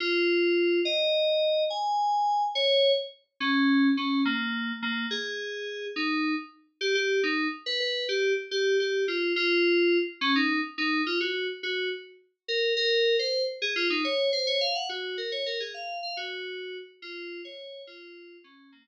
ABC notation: X:1
M:6/8
L:1/8
Q:3/8=141
K:Bbm
V:1 name="Electric Piano 2"
F6 | e6 | a6 | d3 z3 |
D4 D2 | B,4 B,2 | A6 | E3 z3 |
[K:Cm] G G2 E2 z | =B B2 G2 z | G2 G2 F2 | F5 z |
[K:Bbm] D E2 z E2 | F G2 z G2 | z4 B2 | B3 c2 z |
[K:Db] A F E d2 c | d f g G2 B | d B A f2 f | G5 z |
[K:Bbm] F3 d3 | F4 D2 | B,3 z3 |]